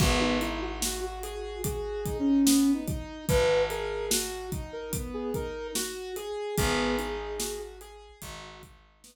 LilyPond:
<<
  \new Staff \with { instrumentName = "Ocarina" } { \time 4/4 \key gis \minor \tempo 4 = 73 fis'16 dis'16 e'16 fis'8 fis'8. \tuplet 3/2 { gis'4 cis'4 dis'4 } | b'8 ais'8 r8. ais'16 r16 gis'16 ais'8 r4 | gis'4. r2 r8 | }
  \new Staff \with { instrumentName = "Acoustic Grand Piano" } { \time 4/4 \key gis \minor b8 dis'8 fis'8 gis'8 fis'8 dis'8 b8 dis'8 | fis'8 gis'8 fis'8 dis'8 b8 dis'8 fis'8 gis'8 | b8 dis'8 fis'8 gis'8 fis'8 dis'8 b8 r8 | }
  \new Staff \with { instrumentName = "Electric Bass (finger)" } { \clef bass \time 4/4 \key gis \minor gis,,1 | gis,,1 | gis,,2 gis,,2 | }
  \new DrumStaff \with { instrumentName = "Drums" } \drummode { \time 4/4 <cymc bd>8 hh8 sn8 hh8 <hh bd>8 <hh bd>8 sn8 <hh bd>8 | <hh bd>8 hh8 sn8 <hh bd>8 <hh bd>8 <hh bd>8 sn8 hh8 | <hh bd>8 hh8 sn8 hh8 <hh bd>8 <hh bd>8 sn4 | }
>>